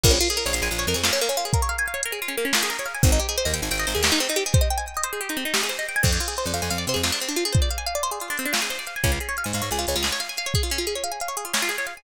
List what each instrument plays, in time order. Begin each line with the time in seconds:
0.04 electric bass (finger) A#1, acoustic guitar (steel) A#3, kick, crash
0.11 acoustic guitar (steel) C#4
0.21 acoustic guitar (steel) F4
0.29 acoustic guitar (steel) G#4, closed hi-hat
0.37 acoustic guitar (steel) A#4
0.46 electric bass (finger) A#1, acoustic guitar (steel) C#5
0.53 electric bass (finger) A#1, acoustic guitar (steel) F5, closed hi-hat
0.62 electric bass (finger) A#1, acoustic guitar (steel) G#5
0.71 electric bass (finger) A#1, acoustic guitar (steel) F5
0.78 acoustic guitar (steel) C#5, closed hi-hat
0.87 electric bass (finger) F2, acoustic guitar (steel) A#4
0.94 electric bass (finger) F2, acoustic guitar (steel) G#4
1.03 acoustic guitar (steel) F4, snare
1.13 acoustic guitar (steel) C#4
1.21 acoustic guitar (steel) A#3
1.29 acoustic guitar (steel) C#4, closed hi-hat
1.37 acoustic guitar (steel) F4
1.45 acoustic guitar (steel) G#4
1.53 acoustic guitar (steel) A#4, kick, closed hi-hat
1.62 acoustic guitar (steel) C#5
1.69 acoustic guitar (steel) F5
1.78 acoustic guitar (steel) G#5, closed hi-hat
1.88 acoustic guitar (steel) F5
1.94 acoustic guitar (steel) C#5
2.03 acoustic guitar (steel) A#4, closed hi-hat
2.12 acoustic guitar (steel) G#4
2.22 acoustic guitar (steel) F4
2.28 acoustic guitar (steel) C#4, closed hi-hat
2.37 acoustic guitar (steel) A#3
2.45 acoustic guitar (steel) C#4
2.53 acoustic guitar (steel) F4, snare
2.63 acoustic guitar (steel) G#4
2.70 acoustic guitar (steel) A#4
2.79 acoustic guitar (steel) C#5, closed hi-hat
2.86 acoustic guitar (steel) F5
2.95 acoustic guitar (steel) G#5
3.03 electric bass (finger) G#1, acoustic guitar (steel) C4, kick, closed hi-hat
3.12 acoustic guitar (steel) D#4
3.20 acoustic guitar (steel) G4
3.29 acoustic guitar (steel) G#4, closed hi-hat
3.38 acoustic guitar (steel) C5
3.45 electric bass (finger) D#2, acoustic guitar (steel) D#5
3.54 electric bass (finger) D#2, acoustic guitar (steel) G5, closed hi-hat
3.62 electric bass (finger) G#1, acoustic guitar (steel) G#5
3.71 electric bass (finger) G#1, acoustic guitar (steel) G5, closed hi-hat
3.78 acoustic guitar (steel) D#5, closed hi-hat
3.87 electric bass (finger) G#1, acoustic guitar (steel) C5
3.95 electric bass (finger) D#2, acoustic guitar (steel) G#4
4.03 acoustic guitar (steel) G4, snare
4.12 acoustic guitar (steel) D#4
4.20 acoustic guitar (steel) C4
4.29 acoustic guitar (steel) D#4, closed hi-hat
4.36 acoustic guitar (steel) G4
4.46 acoustic guitar (steel) G#4
4.54 acoustic guitar (steel) C5, kick, closed hi-hat
4.61 acoustic guitar (steel) D#5
4.70 acoustic guitar (steel) G5
4.78 acoustic guitar (steel) G#5, closed hi-hat
4.88 acoustic guitar (steel) G5
4.97 acoustic guitar (steel) D#5
5.03 acoustic guitar (steel) C5, closed hi-hat
5.13 acoustic guitar (steel) G#4
5.21 acoustic guitar (steel) G4
5.29 acoustic guitar (steel) D#4, closed hi-hat
5.37 acoustic guitar (steel) C4
5.45 acoustic guitar (steel) D#4
5.54 acoustic guitar (steel) G4, snare
5.63 acoustic guitar (steel) G#4
5.69 acoustic guitar (steel) C5
5.79 acoustic guitar (steel) D#5, closed hi-hat
5.89 acoustic guitar (steel) G5
5.96 acoustic guitar (steel) G#5
6.03 electric bass (finger) F2, acoustic guitar (steel) C4, kick, crash
6.12 acoustic guitar (steel) D4
6.20 acoustic guitar (steel) F4, closed hi-hat
6.28 acoustic guitar (steel) G#4
6.37 acoustic guitar (steel) C5, closed hi-hat
6.46 electric bass (finger) F2, acoustic guitar (steel) D5
6.54 electric bass (finger) F2, acoustic guitar (steel) F5, closed hi-hat
6.62 electric bass (finger) F2, acoustic guitar (steel) G#5
6.70 electric bass (finger) F2, acoustic guitar (steel) F5, closed hi-hat
6.78 acoustic guitar (steel) D5
6.87 electric bass (finger) C3, acoustic guitar (steel) C5, closed hi-hat
6.94 electric bass (finger) F2, acoustic guitar (steel) G#4
7.03 acoustic guitar (steel) F4, snare
7.12 acoustic guitar (steel) D4
7.20 acoustic guitar (steel) C4, closed hi-hat
7.29 acoustic guitar (steel) D4
7.36 acoustic guitar (steel) F4, closed hi-hat
7.45 acoustic guitar (steel) G#4
7.53 acoustic guitar (steel) C5, kick, closed hi-hat
7.62 acoustic guitar (steel) D5
7.71 acoustic guitar (steel) F5, closed hi-hat
7.78 acoustic guitar (steel) G#5
7.86 acoustic guitar (steel) F5, closed hi-hat
7.95 acoustic guitar (steel) D5
8.03 acoustic guitar (steel) C5, closed hi-hat
8.11 acoustic guitar (steel) G#4
8.20 acoustic guitar (steel) F4, closed hi-hat
8.30 acoustic guitar (steel) D4
8.37 acoustic guitar (steel) C4, closed hi-hat
8.45 acoustic guitar (steel) D4
8.53 acoustic guitar (steel) F4, snare
8.62 acoustic guitar (steel) G#4
8.70 acoustic guitar (steel) C5, closed hi-hat
8.79 acoustic guitar (steel) D5
8.87 acoustic guitar (steel) F5, closed hi-hat
8.96 acoustic guitar (steel) G#5
9.04 electric bass (finger) C#2, acoustic guitar (steel) C#4, kick, closed hi-hat
9.12 acoustic guitar (steel) F4
9.20 acoustic guitar (steel) G#4, closed hi-hat
9.29 acoustic guitar (steel) C#5
9.37 acoustic guitar (steel) F5, closed hi-hat
9.44 electric bass (finger) G#2, acoustic guitar (steel) G#5
9.53 electric bass (finger) G#2, acoustic guitar (steel) F5, closed hi-hat
9.62 electric bass (finger) G#2, acoustic guitar (steel) C#5
9.71 electric bass (finger) C#2, acoustic guitar (steel) G#4, closed hi-hat
9.79 acoustic guitar (steel) F4
9.87 electric bass (finger) C#2, acoustic guitar (steel) C#4, closed hi-hat
9.95 electric bass (finger) C#2, acoustic guitar (steel) F4
10.03 acoustic guitar (steel) G#4, snare
10.12 acoustic guitar (steel) C#5
10.20 acoustic guitar (steel) F5, closed hi-hat
10.29 acoustic guitar (steel) G#5
10.37 acoustic guitar (steel) F5, closed hi-hat
10.46 acoustic guitar (steel) C#5
10.54 acoustic guitar (steel) G#4, kick, closed hi-hat
10.63 acoustic guitar (steel) F4
10.70 acoustic guitar (steel) C#4, closed hi-hat
10.78 acoustic guitar (steel) F4
10.87 acoustic guitar (steel) G#4, closed hi-hat
10.95 acoustic guitar (steel) C#5
11.04 acoustic guitar (steel) F5, closed hi-hat
11.12 acoustic guitar (steel) G#5
11.20 acoustic guitar (steel) F5, closed hi-hat
11.28 acoustic guitar (steel) C#5
11.37 acoustic guitar (steel) G#4, closed hi-hat
11.45 acoustic guitar (steel) F4
11.53 acoustic guitar (steel) C#4, snare
11.62 acoustic guitar (steel) F4
11.69 acoustic guitar (steel) G#4, closed hi-hat
11.78 acoustic guitar (steel) C#5
11.87 acoustic guitar (steel) F5, closed hi-hat
11.97 acoustic guitar (steel) G#5